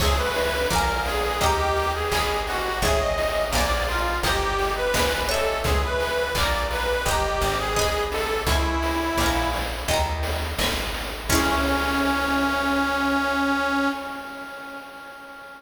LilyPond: <<
  \new Staff \with { instrumentName = "Harmonica" } { \time 4/4 \key cis \minor \tempo 4 = 85 gis'16 b'8. ais'8 gis'8 g'8. gis'8. fis'8 | gis'16 dis''8. d''8 eis'8 g'8. b'8. a'8 | gis'16 b'8. d''8 b'8 g'8. gis'8. a'8 | e'4. r2 r8 |
cis'1 | }
  \new Staff \with { instrumentName = "Acoustic Guitar (steel)" } { \time 4/4 \key cis \minor <cis'' e'' gis''>4 <d'' eis'' gis'' ais''>4 <dis'' g'' ais''>4 <dis'' gis'' b''>4 | <cis'' e'' gis''>4 <d'' eis'' gis'' ais''>4 <dis'' g'' ais''>4 <dis'' gis'' b''>8 <cis'' e'' gis''>8~ | <cis'' e'' gis''>4 <d'' eis'' gis'' ais''>4 <dis'' g'' ais''>4 <dis'' gis'' b''>4 | <cis'' e'' gis''>4 <d'' eis'' gis'' ais''>4 <dis'' g'' ais''>4 <dis'' gis'' b''>4 |
<cis' e' gis'>1 | }
  \new Staff \with { instrumentName = "Acoustic Grand Piano" } { \time 4/4 \key cis \minor <cis'' e'' gis''>16 <cis'' e'' gis''>8. <d'' eis'' gis'' ais''>16 <d'' eis'' gis'' ais''>8. <dis'' g'' ais''>4 <dis'' gis'' b''>8 <dis'' gis'' b''>8 | <cis'' e'' gis''>16 <cis'' e'' gis''>8. <d'' eis'' gis'' ais''>16 <d'' eis'' gis'' ais''>8. <dis'' g'' ais''>4 <dis'' gis'' b''>8 <dis'' gis'' b''>8 | <cis'' e'' gis''>16 <cis'' e'' gis''>8. <d'' eis'' gis'' ais''>16 <d'' eis'' gis'' ais''>8. <dis'' g'' ais''>4 <dis'' gis'' b''>8 <dis'' gis'' b''>8 | r1 |
<cis'' e'' gis''>1 | }
  \new Staff \with { instrumentName = "Electric Bass (finger)" } { \clef bass \time 4/4 \key cis \minor cis,4 ais,,4 dis,4 gis,,4 | gis,,4 ais,,4 g,,4 gis,,4 | cis,4 ais,,4 g,,8 gis,,4. | cis,4 ais,,4 dis,4 gis,,4 |
cis,1 | }
  \new DrumStaff \with { instrumentName = "Drums" } \drummode { \time 4/4 <cymc bd>8 hho8 <hh bd>8 hho8 <hh bd>8 hho8 <hc bd>8 <hho sn>8 | <hh bd>8 hho8 <bd sn>8 hho8 <hh bd>8 hho8 <bd sn>8 sn8 | <hh bd>8 hho8 <hc bd>8 hho8 <hh bd>8 hho8 <hc bd>8 <hho sn>8 | <hh bd>8 <hho sn>8 <bd sn>8 hho8 <hh bd>8 hho8 <bd sn>8 <hho sn>8 |
<cymc bd>4 r4 r4 r4 | }
>>